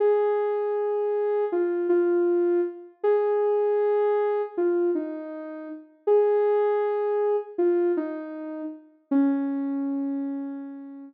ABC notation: X:1
M:4/4
L:1/8
Q:1/4=79
K:Db
V:1 name="Ocarina"
A4 F F2 z | A4 F E2 z | A4 F E2 z | D6 z2 |]